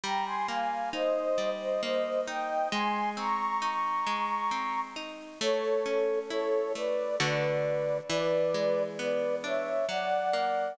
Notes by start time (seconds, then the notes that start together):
0.04 G3 G5 A#5
0.26 G#5 C6
0.48 A#3 F5 G#5
0.93 D#4 C5 D#5
1.38 G3
1.60 C5 D#5
1.83 A#3 C5 D#5
2.27 D#4 D#5 G5
2.72 G#3 G#5 C6
3.17 C4 A#5 C#6
3.62 D#4
4.07 G#3
4.51 C4
4.96 D#4
5.41 A3 A4 C#5
5.86 C#4
6.30 E4 A4 C#5
6.75 A3 B4 D5
7.20 D3 A3 F#4 B4 D5
8.10 E3 B4 D5
8.54 G#3
8.99 B3 B4 D5
9.44 D4 C#5 E5
9.89 F#3 D5 F#5
10.33 A#3